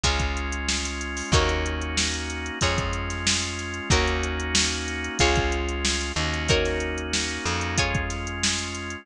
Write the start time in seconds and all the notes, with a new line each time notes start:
0.03 C#2 G#3 C#4 F4 G#4 C#5, kick, closed hi-hat
0.19 kick, closed hi-hat
0.37 closed hi-hat
0.52 closed hi-hat
0.69 snare
0.85 closed hi-hat
1.01 closed hi-hat
1.17 snare, open hi-hat
1.32 D#2 A#3 C#4 D#4 F#4 A#4 C#5, kick, closed hi-hat
1.49 closed hi-hat
1.66 closed hi-hat
1.81 closed hi-hat
1.97 snare
2.14 closed hi-hat
2.30 closed hi-hat
2.46 closed hi-hat
2.61 F2 G#3 C#4 F4 G#4 C#5, kick, closed hi-hat
2.78 kick, closed hi-hat
2.93 closed hi-hat
3.10 snare, closed hi-hat
3.27 snare
3.42 closed hi-hat
3.59 snare, closed hi-hat
3.74 closed hi-hat
3.90 D#2 A#3 C#4 D#4 F#4 A#4 C#5, kick, closed hi-hat
4.07 closed hi-hat
4.23 closed hi-hat
4.40 closed hi-hat
4.55 snare
4.72 closed hi-hat
4.88 closed hi-hat
5.04 closed hi-hat
5.19 C#2 G#3 C#4 F4 G#4 C#5, kick, closed hi-hat
5.36 kick, closed hi-hat
5.52 closed hi-hat
5.69 closed hi-hat
5.85 snare
6.01 closed hi-hat
6.16 D#2 A#3 C#4 D#4 F#4, closed hi-hat
6.34 closed hi-hat
6.49 D#4 F#4 A#4 C#5, kick, closed hi-hat
6.65 snare, closed hi-hat
6.80 closed hi-hat
6.98 closed hi-hat
7.13 snare
7.29 closed hi-hat
7.45 F2, closed hi-hat
7.61 closed hi-hat
7.78 G#3 C#4 F4 G#4 C#5, kick, closed hi-hat
7.94 kick, closed hi-hat
8.10 snare, closed hi-hat
8.27 closed hi-hat
8.43 snare
8.58 closed hi-hat
8.75 closed hi-hat
8.90 closed hi-hat